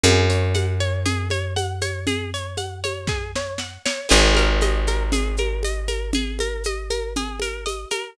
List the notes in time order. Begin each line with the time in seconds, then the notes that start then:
0.03 F#2 G#4, low conga, shaker
0.29 C#5, shaker
0.54 F#5, high conga, shaker
0.80 C#5, shaker
1.05 G#4, low conga, shaker
1.30 C#5, high conga, shaker
1.56 F#5, high conga, shaker
1.81 C#5, high conga, shaker
2.07 G#4, low conga, shaker
2.34 C#5, shaker
2.57 F#5, high conga, shaker
2.84 C#5, high conga, shaker
3.07 G#4, kick, snare
3.35 C#5, snare
3.58 F#5, snare
3.85 C#5, snare
4.09 G#1 G#4, crash, low conga, shaker
4.35 A#4, high conga, shaker
4.61 D#5, high conga, shaker
4.87 A#4, high conga, shaker
5.12 G#4, low conga, shaker
5.37 A#4, high conga, shaker
5.63 D#5, high conga, shaker
5.88 A#4, high conga, shaker
6.13 G#4, low conga, shaker
6.39 A#4, high conga, shaker
6.64 D#5, high conga, shaker
6.90 A#4, high conga, shaker
7.16 G#4, low conga, shaker
7.40 A#4, high conga, shaker
7.66 D#5, high conga, shaker
7.90 A#4, high conga, shaker